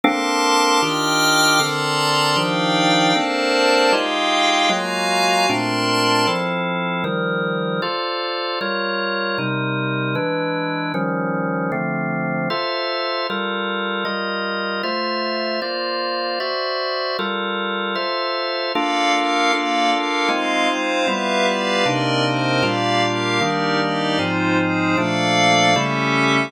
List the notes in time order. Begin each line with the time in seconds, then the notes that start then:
0.04 A#3 C4 D4 A4 A#4 A5 C6 D6
0.81 D#3 D4 F4 G4 D#5 G5 D6 F6
1.59 D3 C4 A4 A#4 D5 A5 A#5 C6
2.36 D#3 F3 D4 D#4 G4 D5 F5 G5
3.15 A#3 C4 D4 A4 A#4 C5 D5 A5
3.93 G#3 D#4 F4 G4 G#4 D#5 F5 G5
4.69 F#3 G#3 A#3 F4 F#4 F5 G#5 A#5
5.49 A#2 A3 C4 D4 A#4 D5 A5 C6
6.27 F3 C4 E4 A4
7.04 D#3 F3 G3 A#4
7.82 F4 A4 C5 D5
8.61 G3 F4 A#4 C#5
9.38 C3 G3 D#4 A#4
10.15 E3 G#3 D4 B4
10.94 D#3 F3 G3 C#4
11.72 D3 F3 A3 C4
12.50 F4 A4 C5 E5
13.30 G3 F4 A4 A#4
14.05 G3 F4 A#4 D#5
14.83 A3 F4 C5 E5
15.62 A#3 F4 C5 D5
16.40 F#4 C5 D5 E5
17.19 G3 F4 A4 A#4
17.95 F4 A4 C5 E5
18.73 A#3 D4 F4 A4 D5 F5
19.12 A#3 A4 A#4 F5
19.52 A#3 D4 F4 A4 D5 F5
19.91 A#3 A4 A#4 F5
20.29 G#3 C4 D#4 F4 D#5 F5
20.68 G#3 C4 C5 F5
21.07 G3 B3 E4 F4 G4 B4 E5 F5
21.46 G4 B4 D5 F5
21.85 C3 A#3 C4 D4 D#4 A#4 D5 D#5
22.25 C4 A#4 C5 D#5
22.62 A#2 G3 A#3 D4 F4 G4 D5 F5
23.02 A#3 G4 A#4 F5
23.41 D#3 G3 A#3 D4 D#4 G4 A#4 D5
23.80 D#4 G4 D5 D#5
24.19 G#2 F3 G#3 C4 D#4 F4 C5
24.58 G#3 D#4 G#4 C5
24.97 A#2 F3 A3 A#3 D4 A4 D5 F5
25.75 C#3 G3 A3 C#4 E4 G4 A4 E5